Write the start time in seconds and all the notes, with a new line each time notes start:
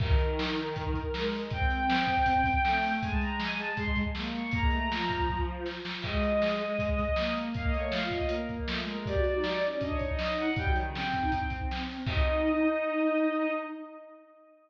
0.00 D#3 A#4, kick, crash
0.18 closed hi-hat
0.39 snare
0.57 closed hi-hat
0.76 kick, closed hi-hat
0.94 kick, closed hi-hat
1.13 G#3, snare
1.32 open hi-hat
1.50 C4 G5, kick, closed hi-hat
1.70 closed hi-hat
1.90 snare
2.07 kick, closed hi-hat
2.26 kick, closed hi-hat
2.44 kick, closed hi-hat
2.64 A3, snare
2.82 open hi-hat
3.01 G#3 G#5, kick, closed hi-hat
3.11 A5
3.21 A#5, closed hi-hat
3.40 G#5, snare
3.59 A5, closed hi-hat
3.77 C6, kick, closed hi-hat
3.96 kick, closed hi-hat
4.15 A#3, snare
4.34 C#6, closed hi-hat
4.51 A#3 A#5, kick, closed hi-hat
4.61 G#3
4.71 A3, closed hi-hat
4.89 F3, snare
5.10 kick, closed hi-hat
5.29 kick
5.66 snare
5.85 snare
6.02 G#3 D#5, kick, crash
6.23 closed hi-hat
6.42 snare
6.60 closed hi-hat
6.79 kick, closed hi-hat
6.98 kick, closed hi-hat
7.16 A#3, snare
7.36 closed hi-hat
7.54 A#3 F5, kick, closed hi-hat
7.64 D#5
7.73 A3 C#5, closed hi-hat
7.92 F4 F5, snare
8.11 D#5, kick, closed hi-hat
8.29 A#3 A#4, closed hi-hat
8.49 A#3, kick, closed hi-hat
8.67 A3, snare
8.76 G#3
8.87 A#4, closed hi-hat
8.96 G#3
9.06 G4 D5, kick, closed hi-hat
9.16 F#4
9.24 F#4, closed hi-hat
9.35 D#4
9.44 snare
9.62 C#4, closed hi-hat
9.80 D4 D#5, kick, closed hi-hat
9.90 C#5
9.99 D#4, kick, closed hi-hat
10.09 D#5
10.19 snare
10.38 F#5, closed hi-hat
10.56 G3 G5, kick, closed hi-hat
10.65 F#3
10.74 D#3, closed hi-hat
10.86 C#3
10.94 C4 G5, snare
11.12 kick, closed hi-hat
11.21 D#4
11.32 C4, kick, closed hi-hat
11.50 kick, closed hi-hat
11.71 snare
11.89 open hi-hat
12.07 D#4 D#5, kick, crash